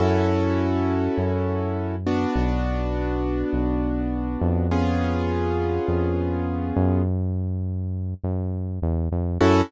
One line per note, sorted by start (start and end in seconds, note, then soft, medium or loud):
0.00 1.08 F#2 loud
0.00 1.96 C#4 medium
0.00 1.96 E4 medium
0.00 1.96 F#4 medium
0.00 1.96 A4 medium
1.18 2.26 F#2 medium
2.07 4.67 B3 medium
2.07 4.67 D4 medium
2.07 4.67 F#4 medium
2.36 3.44 B1 loud
3.53 4.37 B1 medium
4.41 5.79 F2 loud
4.71 7.02 B3 medium
4.71 7.02 C#4 medium
4.71 7.02 F4 medium
4.71 7.02 G#4 medium
5.88 6.72 F2 medium
6.76 8.14 F#2 loud
8.24 8.79 F#2 medium
8.82 9.09 E2 loud
9.12 9.38 F2 medium
9.41 9.62 F#2 loud
9.41 9.61 C#4 loud
9.41 9.61 E4 loud
9.41 9.61 F#4 loud
9.41 9.61 A4 loud